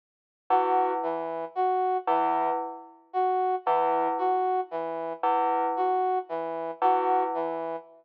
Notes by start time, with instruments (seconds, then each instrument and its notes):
0.50 tubular bells E2, brass section F#4
1.03 brass section E3
1.55 brass section F#4
2.07 tubular bells E2, brass section E3
3.13 brass section F#4
3.66 tubular bells E2, brass section E3
4.18 brass section F#4
4.71 brass section E3
5.23 tubular bells E2
5.77 brass section F#4
6.29 brass section E3
6.82 tubular bells E2, brass section F#4
7.34 brass section E3